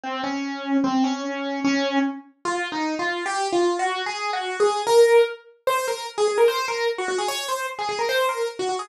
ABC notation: X:1
M:2/4
L:1/16
Q:1/4=149
K:Db
V:1 name="Acoustic Grand Piano"
C2 D6 | C2 D6 | D4 z4 | [K:Bbm] (3F4 E4 F4 |
(3=G4 F4 _G4 | (3A4 G4 A4 | B4 z4 | [K:Db] c2 B2 z A A B |
c2 B2 z G G A | ^c2 =c2 z A A B | c2 B2 z G G A |]